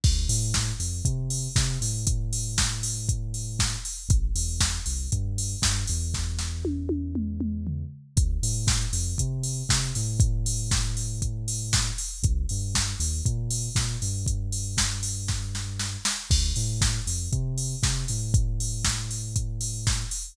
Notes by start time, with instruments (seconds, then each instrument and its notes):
0.04 synth bass 2 D2, kick, crash
0.29 synth bass 2 A2, open hi-hat
0.54 kick, snare
0.80 synth bass 2 F2, open hi-hat
1.05 synth bass 2 C3, kick, closed hi-hat
1.30 open hi-hat
1.56 synth bass 2 C3, kick, snare
1.81 synth bass 2 A2, open hi-hat
2.07 kick, closed hi-hat
2.33 open hi-hat
2.58 kick, snare
2.83 open hi-hat
3.09 kick, closed hi-hat
3.34 open hi-hat
3.59 kick, snare
3.85 open hi-hat
4.09 synth bass 2 A1, kick, closed hi-hat
4.35 synth bass 2 E2, open hi-hat
4.60 kick, snare
4.86 synth bass 2 C2, open hi-hat
5.12 synth bass 2 G2, kick, closed hi-hat
5.38 open hi-hat
5.62 synth bass 2 G2, kick, snare
5.87 synth bass 2 E2, open hi-hat
6.14 kick, snare
6.39 snare
6.65 high tom
6.89 high tom
7.15 mid tom
7.40 mid tom
7.67 floor tom
8.17 synth bass 2 D2, kick, closed hi-hat
8.43 synth bass 2 A2, open hi-hat
8.67 kick, snare
8.93 synth bass 2 F2, open hi-hat
9.18 synth bass 2 C3, kick, closed hi-hat
9.43 open hi-hat
9.69 synth bass 2 C3, kick, snare
9.95 synth bass 2 A2, open hi-hat
10.20 kick, closed hi-hat
10.46 open hi-hat
10.71 kick, snare
10.97 open hi-hat
11.22 kick, closed hi-hat
11.48 open hi-hat
11.73 kick, snare
11.98 open hi-hat
12.23 synth bass 2 C2, kick, closed hi-hat
12.49 synth bass 2 G2, open hi-hat
12.75 kick, snare
12.99 synth bass 2 D#2, open hi-hat
13.26 synth bass 2 A#2, kick, closed hi-hat
13.51 open hi-hat
13.75 synth bass 2 A#2, kick, snare
14.02 synth bass 2 G2, open hi-hat
14.26 kick, closed hi-hat
14.52 open hi-hat
14.77 kick, snare
15.03 open hi-hat
15.28 kick, snare
15.55 snare
15.79 snare
16.05 snare
16.30 synth bass 2 D2, kick, crash
16.56 synth bass 2 A2, open hi-hat
16.81 kick, snare
17.07 synth bass 2 F2, open hi-hat
17.32 synth bass 2 C3, kick, closed hi-hat
17.58 open hi-hat
17.83 synth bass 2 C3, kick, snare
18.08 synth bass 2 A2, open hi-hat
18.34 kick, closed hi-hat
18.60 open hi-hat
18.85 kick, snare
19.11 open hi-hat
19.36 kick, closed hi-hat
19.61 open hi-hat
19.87 kick, snare
20.11 open hi-hat